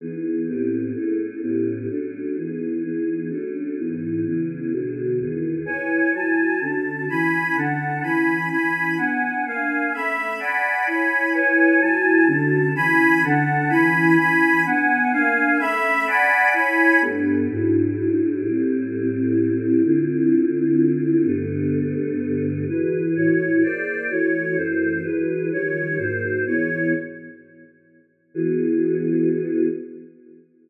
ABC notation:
X:1
M:3/4
L:1/8
Q:1/4=127
K:Emix
V:1 name="Choir Aahs"
[E,B,^DG]2 [A,,B,=C=G]2 [A,^CE^G]2 | [A,,B,C=G]2 [F,A,CD]2 [E,^G,B,^D]2 | [E,G,B,^D]2 [F,A,C=D]2 [G,,E,B,^D]2 | [C,E,G,B,]2 [B,,D,F,G,]2 [E,,^D,G,B,]2 |
[EBcg]2 [F,Ega]2 [D,CFa]2 | [E,Cgb]2 [D,Cfa]2 [E,Cgb]2 | [E,Cgb]2 [B,Dfg]2 [_B,D=f_a]2 | [A,Ceb]2 [dfgb]2 [Ecgb]2 |
[EBcg]2 [F,Ega]2 [D,CFa]2 | [E,Cgb]2 [D,Cfa]2 [E,Cgb]2 | [E,Cgb]2 [B,Dfg]2 [_B,D=f_a]2 | [A,Ceb]2 [dfgb]2 [Ecgb]2 |
[K:Gmix] [G,,A,B,D]2 [^G,,^F,DE]4 | [A,,G,CE]6 | [D,CEF]6 | [G,,D,A,B,]6 |
[K:Emix] [E,FGB]2 [A,,E,Fc]2 [_B,_A=cd]2 | [E,A,Fc]2 [F,,E,A,=c]2 [E,F,G,B]2 | [^D,^E,=G,c]2 [^G,,F,^A,^B]2 [=E,^G,=B,c]2 | z6 |
[E,B,FG]6 |]